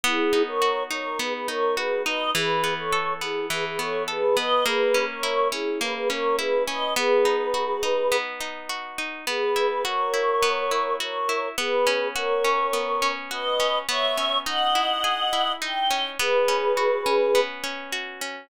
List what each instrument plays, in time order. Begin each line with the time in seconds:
0.03 acoustic guitar (steel) B3, choir aahs E4 G#4
0.33 acoustic guitar (steel) D#4
0.47 choir aahs A#4 C#5
0.62 acoustic guitar (steel) F#4
0.91 acoustic guitar (steel) D#4, choir aahs A#4 C#5
1.19 acoustic guitar (steel) B3, choir aahs G#4 B4
1.34 choir aahs G#4 B4
1.47 acoustic guitar (steel) D#4, choir aahs A#4 C#5
1.76 acoustic guitar (steel) F#4, choir aahs G#4 B4
2.05 acoustic guitar (steel) D#4, choir aahs B4 D#5
2.34 acoustic guitar (steel) E3, choir aahs G#4 B4
2.64 acoustic guitar (steel) B3
2.78 choir aahs A4 C#5
2.92 acoustic guitar (steel) A4
3.21 acoustic guitar (steel) B3, choir aahs E4 G#4
3.50 acoustic guitar (steel) E3, choir aahs G#4 B4
3.66 choir aahs G#4 B4
3.79 acoustic guitar (steel) B3, choir aahs A4 C#5
4.08 choir aahs G#4 B4, acoustic guitar (steel) A4
4.37 acoustic guitar (steel) B3, choir aahs B4 D#5
4.66 acoustic guitar (steel) A#3, choir aahs G#4 B4
4.94 acoustic guitar (steel) C#4
5.09 choir aahs A#4 C#5
5.23 acoustic guitar (steel) E4
5.52 acoustic guitar (steel) C#4, choir aahs E4 G#4
5.80 acoustic guitar (steel) A#3, choir aahs G#4 B4
5.95 choir aahs G#4 B4
6.10 acoustic guitar (steel) C#4, choir aahs A#4 C#5
6.38 acoustic guitar (steel) E4, choir aahs G#4 B4
6.66 acoustic guitar (steel) C#4, choir aahs B4 D#5
6.96 acoustic guitar (steel) B3, choir aahs G#4 B4
7.25 acoustic guitar (steel) D#4
7.54 acoustic guitar (steel) F#4
7.83 acoustic guitar (steel) D#4
8.12 acoustic guitar (steel) B3
8.41 acoustic guitar (steel) D#4
8.69 acoustic guitar (steel) F#4
8.98 acoustic guitar (steel) D#4
9.27 acoustic guitar (steel) B3, choir aahs G#4 B4
9.56 acoustic guitar (steel) E4
9.85 acoustic guitar (steel) F#4, choir aahs A#4 C#5
10.14 acoustic guitar (steel) E4
10.42 acoustic guitar (steel) B3
10.71 acoustic guitar (steel) E4
11.00 acoustic guitar (steel) F#4, choir aahs A#4 C#5
11.29 acoustic guitar (steel) E4
11.58 acoustic guitar (steel) B3, choir aahs G#4 B4
11.87 acoustic guitar (steel) C#4
12.15 acoustic guitar (steel) F#4, choir aahs A#4 C#5
12.44 acoustic guitar (steel) C#4
12.73 acoustic guitar (steel) B3
13.02 acoustic guitar (steel) C#4
13.31 acoustic guitar (steel) F#4, choir aahs B4 D#5
13.60 acoustic guitar (steel) C#4
13.89 acoustic guitar (steel) B3, choir aahs C#5 E5
14.17 acoustic guitar (steel) C#4
14.45 acoustic guitar (steel) D#4, choir aahs D#5 F#5
14.75 acoustic guitar (steel) E4
15.04 acoustic guitar (steel) G#4
15.33 acoustic guitar (steel) E4
15.61 acoustic guitar (steel) D#4, choir aahs G5
15.91 acoustic guitar (steel) C#4
16.19 acoustic guitar (steel) B3, choir aahs G#4 B4
16.48 acoustic guitar (steel) C#4
16.77 acoustic guitar (steel) F#4
17.06 acoustic guitar (steel) C#4
17.35 acoustic guitar (steel) B3
17.64 acoustic guitar (steel) C#4
17.92 acoustic guitar (steel) F#4
18.21 acoustic guitar (steel) C#4